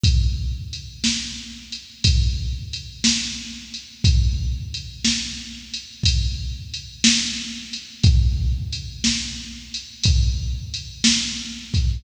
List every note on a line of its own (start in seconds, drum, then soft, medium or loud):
0.04 kick medium
0.04 closed hi-hat medium
0.73 closed hi-hat medium
1.04 snare loud
1.72 closed hi-hat medium
2.04 kick medium
2.04 closed hi-hat loud
2.73 closed hi-hat medium
3.04 snare loud
3.74 closed hi-hat medium
4.04 kick loud
4.04 closed hi-hat medium
4.74 closed hi-hat medium
5.05 snare loud
5.74 closed hi-hat medium
6.03 kick medium
6.03 closed hi-hat loud
6.74 closed hi-hat medium
7.04 snare loud
7.73 closed hi-hat medium
8.04 kick loud
8.04 closed hi-hat medium
8.72 closed hi-hat medium
9.04 snare loud
9.74 closed hi-hat medium
10.04 kick medium
10.04 closed hi-hat loud
10.74 closed hi-hat medium
11.04 snare loud
11.74 kick medium
11.74 closed hi-hat medium